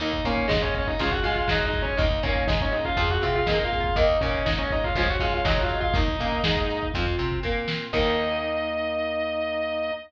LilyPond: <<
  \new Staff \with { instrumentName = "Distortion Guitar" } { \time 4/4 \key ees \dorian \tempo 4 = 121 <ees' ees''>8 <des' des''>8 <ees' ees''>16 <des' des''>16 <des' des''>16 <ees' ees''>16 <f' f''>16 <ges' ges''>16 <f' f''>16 <f' f''>16 \tuplet 3/2 { <ees' ees''>8 <ees' ees''>8 <des' des''>8 } | <ees' ees''>8 <des' des''>8 <ees' ees''>16 <des' des''>16 <ees' ees''>16 <f' f''>16 <f' f''>16 <ges' ges''>16 <f' f''>16 <f' f''>16 \tuplet 3/2 { <ees' ees''>8 <f' f''>8 <f' f''>8 } | <ees' ees''>8 <des' des''>8 <ees' ees''>16 <des' des''>16 <ees' ees''>16 <f' f''>16 <f' f''>16 <ges' ges''>16 <f' f''>16 <f' f''>16 \tuplet 3/2 { <ees' ees''>8 <f' f''>8 <f' f''>8 } | <ees' ees''>2 r2 |
ees''1 | }
  \new Staff \with { instrumentName = "Flute" } { \time 4/4 \key ees \dorian ees'4. des'8 aes'4. aes'8 | ees'4. des'8 aes'4. aes'8 | ees''4. des''8 des''4. ees''8 | ees'8 des'16 r16 ees'4 f'4 r4 |
ees'1 | }
  \new Staff \with { instrumentName = "Overdriven Guitar" } { \time 4/4 \key ees \dorian <ees bes>8 bes8 aes4 <des f aes>8 aes8 ges4 | <ees bes>8 bes8 aes4 <f c'>8 c'8 bes4 | <ees bes>8 bes8 aes4 <des f aes>8 aes8 ges4 | <ees bes>8 bes8 aes4 <f c'>8 c'8 bes4 |
<ees bes>1 | }
  \new Staff \with { instrumentName = "Electric Bass (finger)" } { \clef bass \time 4/4 \key ees \dorian ees,8 bes,8 aes,4 des,8 aes,8 ges,4 | ees,8 bes,8 aes,4 f,8 c8 bes,4 | ees,8 bes,8 aes,4 des,8 aes,8 ges,4 | ees,8 bes,8 aes,4 f,8 c8 bes,4 |
ees,1 | }
  \new Staff \with { instrumentName = "Drawbar Organ" } { \time 4/4 \key ees \dorian <bes ees'>2 <aes des' f'>4 <aes f' aes'>4 | <bes ees'>2 <c' f'>2 | <bes ees'>2 <aes des' f'>4 <aes f' aes'>4 | <bes ees'>2 <c' f'>2 |
<bes ees'>1 | }
  \new DrumStaff \with { instrumentName = "Drums" } \drummode { \time 4/4 hh16 bd16 bd16 bd16 <hh bd sn>16 bd16 <hh bd>16 bd16 <hh bd>16 bd16 <hh bd>16 bd16 <bd sn>16 bd16 <hh bd>16 bd16 | <hh bd>16 bd16 <hh bd>16 bd16 <bd sn>16 bd16 hh16 bd16 <hh bd>16 bd16 <hh bd>16 bd16 <bd sn>16 bd16 <hh bd>16 bd16 | <hh bd>16 bd16 <hh bd>16 bd16 <bd sn>16 bd16 <hh bd>16 bd16 <hh bd>16 bd16 <hh bd>16 bd16 <bd sn>16 bd16 <hh bd>16 bd16 | <hh bd>16 bd16 <hh bd>16 bd16 <bd sn>16 bd16 hh16 bd16 <hh bd>16 bd16 <hh bd>16 bd16 bd8 sn8 |
<cymc bd>4 r4 r4 r4 | }
>>